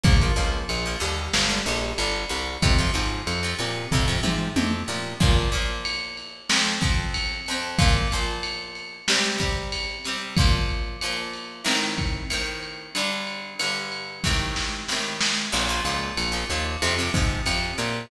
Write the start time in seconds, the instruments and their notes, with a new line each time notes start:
0.03 electric bass (finger) A#1, acoustic guitar (steel) F3 A#3, kick, ride
0.21 acoustic guitar (steel) F3 A#3
0.36 electric bass (finger) C#2, acoustic guitar (steel) F3 A#3, ride
0.69 electric bass (finger) A#1, ride
0.85 acoustic guitar (steel) F3 A#3
1.00 electric bass (finger) D#2, acoustic guitar (steel) D3 G3, ride
1.33 electric bass (finger) G1, snare
1.49 acoustic guitar (steel) D3 G3
1.66 electric bass (finger) A#1, acoustic guitar (steel) D3 G3, ride
1.98 electric bass (finger) G1, acoustic guitar (steel) D3 G3, ride
2.29 electric bass (finger) C2, acoustic guitar (steel) D3 G3, ride
2.62 electric bass (finger) F2, acoustic guitar (steel) C3 F3, kick, ride
2.78 acoustic guitar (steel) C3 F3
2.94 electric bass (finger) G#2, acoustic guitar (steel) C3 F3, ride
3.27 electric bass (finger) F2, ride
3.43 acoustic guitar (steel) C3 F3
3.58 electric bass (finger) A#2, acoustic guitar (steel) C3 F3, ride
3.91 electric bass (finger) F2, acoustic guitar (steel) C3 F3, kick, floor tom
4.08 acoustic guitar (steel) C3 F3
4.23 electric bass (finger) G#2, acoustic guitar (steel) C3 F3, mid tom
4.56 electric bass (finger) F2, acoustic guitar (steel) C3 F3, high tom
4.88 electric bass (finger) A#2, acoustic guitar (steel) C3 F3
5.20 acoustic guitar (steel) A#2 F3 A#3, kick, crash
5.52 acoustic guitar (steel) A#2 F3 A#3, ride
5.85 ride
6.17 ride
6.49 acoustic guitar (steel) F2 F3 C4, snare
6.81 acoustic guitar (steel) F2 F3 C4, kick, ride
7.14 ride
7.46 acoustic guitar (steel) F2 F3, ride
7.51 acoustic guitar (steel) C4
7.78 acoustic guitar (steel) A#2 F3 A#3, kick, ride
8.11 acoustic guitar (steel) A#2 F3 A#3, ride
8.43 ride
8.75 ride
9.08 acoustic guitar (steel) C3 G3 C4, snare
9.38 acoustic guitar (steel) C3 G3 C4, kick, ride
9.72 ride
10.04 acoustic guitar (steel) C3 G3 C4, ride
10.37 acoustic guitar (steel) A#2 F3 A#3, kick, ride
10.69 ride
11.01 acoustic guitar (steel) A#2 F3 A#3, ride
11.33 ride
11.64 acoustic guitar (steel) A2 D#3 C4, snare
11.98 kick, ride
12.30 acoustic guitar (steel) A2 D#3 C4, ride
12.63 ride
12.95 acoustic guitar (steel) G2 D3 G3, ride
13.27 ride
13.59 acoustic guitar (steel) G2 D3 G3, ride
13.92 ride
14.24 acoustic guitar (steel) A2 C3 D#3, kick, snare
14.56 snare
14.88 acoustic guitar (steel) A2 C3 D#3, snare
15.21 snare
15.52 electric bass (finger) A#1, acoustic guitar (steel) A#2 F3, crash
15.69 acoustic guitar (steel) A#2 F3
15.85 electric bass (finger) C#2, acoustic guitar (steel) A#2 F3, ride
16.17 electric bass (finger) A#1, ride
16.32 acoustic guitar (steel) A#2 F3
16.50 electric bass (finger) D#2, acoustic guitar (steel) A#2 F3, ride
16.82 electric bass (finger) F2, acoustic guitar (steel) C3 F3, ride
16.99 acoustic guitar (steel) C3 F3
17.14 electric bass (finger) G#2, acoustic guitar (steel) C3 F3, kick, ride
17.46 electric bass (finger) F2, acoustic guitar (steel) C3 F3, ride
17.78 electric bass (finger) A#2, acoustic guitar (steel) C3 F3, ride